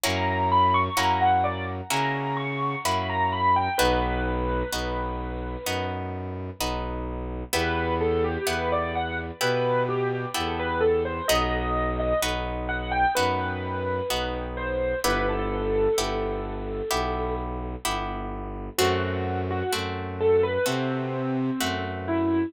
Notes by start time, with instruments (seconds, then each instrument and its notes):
0.03 violin F#2, orchestral harp A#3 C#4 E4 F#4, acoustic grand piano A#5
0.52 acoustic grand piano B5
0.74 acoustic grand piano C#6
0.97 violin F#2, orchestral harp A#3 C#4 E4 F#4, acoustic grand piano A#5
1.21 acoustic grand piano F#5
1.44 acoustic grand piano D5
1.90 violin C#3, orchestral harp A#3 C#4 E4 F#4, acoustic grand piano A#5
2.37 acoustic grand piano C#6
2.84 violin F#2, orchestral harp A#3 C#4 E4 F#4, acoustic grand piano B5
3.09 acoustic grand piano A#5
3.32 acoustic grand piano B5
3.56 acoustic grand piano G5
3.78 violin B1, orchestral harp B3 D#4 F#4, acoustic grand piano B4
4.72 violin B1, orchestral harp B3 D#4 F#4
5.66 violin F#2, orchestral harp B3 D#4 F#4
6.59 violin B1, orchestral harp B3 D#4 F#4
7.53 violin E2, orchestral harp B3 E4 G4, acoustic grand piano B4
8.01 acoustic grand piano A4
8.24 acoustic grand piano G4
8.47 violin E2, orchestral harp B3 E4 G4, acoustic grand piano B4
8.72 acoustic grand piano D5
8.95 acoustic grand piano F#5
9.41 violin B2, orchestral harp B3 E4 G4, acoustic grand piano B4
9.89 acoustic grand piano G4
10.34 violin E2, orchestral harp B3 E4 G4, acoustic grand piano A4
10.59 acoustic grand piano B4
10.80 acoustic grand piano A4
11.05 acoustic grand piano C5
11.28 violin B1, orchestral harp B3 D#4 F#4, acoustic grand piano D#5
12.00 acoustic grand piano D#5
12.21 violin B1, orchestral harp B3 D#4 F#4
12.69 acoustic grand piano F#5
12.91 acoustic grand piano G5
13.15 violin F#2, orchestral harp B3 D#4 F#4, acoustic grand piano B4
14.10 violin B1, orchestral harp B3 D#4 F#4
14.57 acoustic grand piano C5
15.04 violin G1, orchestral harp B3 E4 G4, acoustic grand piano B4
15.29 acoustic grand piano A4
15.97 violin G1, orchestral harp B3 E4 G4
16.90 violin B1, orchestral harp B3 E4 G4
17.85 violin G1, orchestral harp B3 E4 G4
18.78 violin F#2, orchestral harp A3 C4 F#4, acoustic grand piano F#4
19.51 acoustic grand piano F#4
19.72 violin F#2, orchestral harp A3 C4 F#4
20.21 acoustic grand piano A4
20.43 acoustic grand piano B4
20.66 violin C3, orchestral harp A3 C4 F#4, acoustic grand piano C4
21.60 violin F#2, orchestral harp A3 C4 F#4
22.08 acoustic grand piano E4